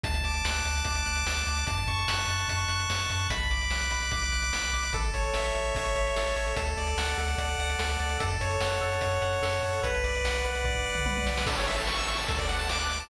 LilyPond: <<
  \new Staff \with { instrumentName = "Lead 1 (square)" } { \time 4/4 \key a \major \tempo 4 = 147 a''8 d'''8 fis'''8 a''8 d'''8 fis'''8 a''8 d'''8 | a''8 cis'''8 fis'''8 a''8 cis'''8 fis'''8 a''8 cis'''8 | b''8 d'''8 fis'''8 b''8 d'''8 fis'''8 b''8 d'''8 | a'8 cis''8 e''8 a'8 cis''8 e''8 a'8 cis''8 |
a'8 d''8 fis''8 a'8 d''8 fis''8 a'8 d''8 | a'8 cis''8 fis''8 a'8 cis''8 fis''8 a'8 cis''8 | b'8 d''8 fis''8 b'8 d''8 fis''8 b'8 d''8 | a'16 cis''16 e''16 a''16 cis'''16 e'''16 cis'''16 a''16 a'16 d''16 fis''16 a''16 d'''16 fis'''16 d'''16 a''16 | }
  \new Staff \with { instrumentName = "Synth Bass 1" } { \clef bass \time 4/4 \key a \major d,8 d,8 d,8 d,8 d,8 d,8 d,8 d,8 | fis,8 fis,8 fis,8 fis,8 fis,8 fis,8 fis,8 fis,8 | b,,8 b,,8 b,,8 b,,8 b,,8 b,,8 b,,8 b,,8 | a,,8 a,,8 a,,8 a,,8 a,,8 a,,8 a,,8 a,,8 |
d,8 d,8 d,8 d,8 d,8 d,8 d,8 d,8 | fis,8 fis,8 fis,8 fis,8 fis,8 fis,8 fis,8 fis,8 | b,,8 b,,8 b,,8 b,,8 b,,8 b,,8 b,,8 b,,8 | a,,2 d,2 | }
  \new DrumStaff \with { instrumentName = "Drums" } \drummode { \time 4/4 <hh bd>16 hh16 hh16 hh16 sn16 hh16 hh16 hh16 <hh bd>16 hh16 hh16 hh16 sn16 hh16 hh16 hh16 | <hh bd>16 hh16 <hh bd>16 hh16 sn16 hh16 hh16 hh16 <hh bd>16 hh16 hh16 hh16 sn16 hh16 hh16 hh16 | <hh bd>16 hh16 hh16 hh16 sn16 hh16 hh16 hh16 <hh bd>16 hh16 hh16 hh16 sn16 hh16 hh16 hh16 | <hh bd>16 hh16 <hh bd>16 hh16 sn16 hh16 hh16 hh16 <hh bd>16 hh16 hh16 hh16 sn16 hh16 hh16 hh16 |
<hh bd>16 hh16 hh16 hh16 sn16 hh16 hh16 hh16 <hh bd>16 hh16 hh16 hh16 sn16 hh16 hh16 hh16 | <hh bd>16 hh16 <hh bd>16 hh16 sn16 hh16 hh16 hh16 <hh bd>16 hh16 hh16 hh16 sn16 hh16 hh16 hh16 | <hh bd>16 hh16 hh16 hh16 sn16 hh16 hh16 hh16 <bd tomfh>16 tomfh8 toml16 tommh16 tommh16 sn16 sn16 | <cymc bd>16 hh16 hh16 hh16 sn16 hh16 hh16 hh16 <hh bd>16 <hh bd>16 hh16 hh16 sn16 hh16 hh16 hh16 | }
>>